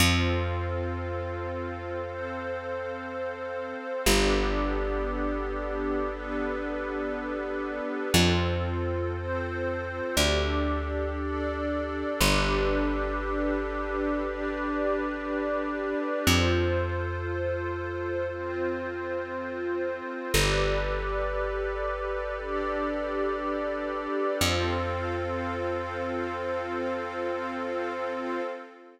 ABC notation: X:1
M:4/4
L:1/8
Q:1/4=59
K:Flyd
V:1 name="Pad 5 (bowed)"
[CFA]4 [CAc]4 | [B,DGA]4 [B,DAB]4 | [CFA]2 [CAc]2 [DGA]2 [DAd]2 | [DGAB]4 [DGBd]4 |
[FAc]4 [CFc]4 | [GABd]4 [DGAd]4 | [CFA]8 |]
V:2 name="Pad 2 (warm)"
[Acf]8 | [GABd]8 | [FAc]4 [GAd]4 | [GABd]8 |
[FAc]8 | [GABd]8 | [Acf]8 |]
V:3 name="Electric Bass (finger)" clef=bass
F,,8 | G,,,8 | F,,4 D,,4 | G,,,8 |
F,,8 | G,,,8 | F,,8 |]